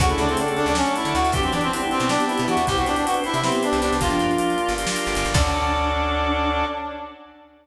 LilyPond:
<<
  \new Staff \with { instrumentName = "Clarinet" } { \time 7/8 \key d \mixolydian \tempo 4 = 157 fis'16 e'16 d'16 c'16 d'16 r16 d'16 d'16 cis'8 e'8 fis'8 | g'16 c'16 d'16 c'16 c'16 r16 c'16 c'16 d'8 e'8 fis'8 | g'16 fis'16 d'16 d'16 fis'16 r16 e'16 e'16 c'8 d'8 d'8 | f'2 r4. |
d'2.~ d'8 | }
  \new Staff \with { instrumentName = "Choir Aahs" } { \time 7/8 \key d \mixolydian <cis a>2 r4. | <fis d'>8 r8 <g e'>8 r8 <b g'>4. | <e' c''>8 r8 <d' b'>8 r8 <b g'>4. | <f d'>4. r2 |
d'2.~ d'8 | }
  \new Staff \with { instrumentName = "Drawbar Organ" } { \time 7/8 \key d \mixolydian <cis' d' fis' a'>4 <cis' d' fis' a'>4 <cis' d' fis' a'>4. | <b d' e' g'>4 <b d' e' g'>4 <b d' e' g'>4. | <b c' e' g'>4 <b c' e' g'>4 <b c' e' g'>4. | <bes d' f' g'>4 <bes d' f' g'>4 <bes d' f' g'>4. |
<cis' d' fis' a'>2.~ <cis' d' fis' a'>8 | }
  \new Staff \with { instrumentName = "Electric Bass (finger)" } { \clef bass \time 7/8 \key d \mixolydian d,8 d,4~ d,16 d,4 d16 d,16 d,16 | e,8 e4~ e16 b,4 b,16 e16 e,16 | c,8 c,4~ c,16 c4 c,16 c,16 c,16 | g,,8 g,4~ g,16 g,,4 g,,16 g,,16 g,,16 |
d,2.~ d,8 | }
  \new Staff \with { instrumentName = "Drawbar Organ" } { \time 7/8 \key d \mixolydian <cis' d' fis' a'>2.~ <cis' d' fis' a'>8 | <b d' e' g'>2.~ <b d' e' g'>8 | <b c' e' g'>2.~ <b c' e' g'>8 | <bes d' f' g'>2.~ <bes d' f' g'>8 |
<cis' d' fis' a'>2.~ <cis' d' fis' a'>8 | }
  \new DrumStaff \with { instrumentName = "Drums" } \drummode { \time 7/8 <hh bd>16 hh16 hh16 hh16 hh16 hh16 hh16 hh16 sn16 hh16 hh16 hh16 hh16 hh16 | <hh bd>16 hh16 hh16 hh16 hh16 hh16 hh16 hh16 sn16 hh16 hh16 hh16 hh16 hh16 | <hh bd>16 hh16 hh16 hh16 hh16 hh16 hh16 hh16 sn16 hh16 hh16 hh16 hh16 hh16 | <hh bd>16 hh16 hh16 hh16 hh16 hh16 hh16 hh16 hh16 sn16 hh16 hh16 hh16 hh16 |
<cymc bd>4 r4 r4. | }
>>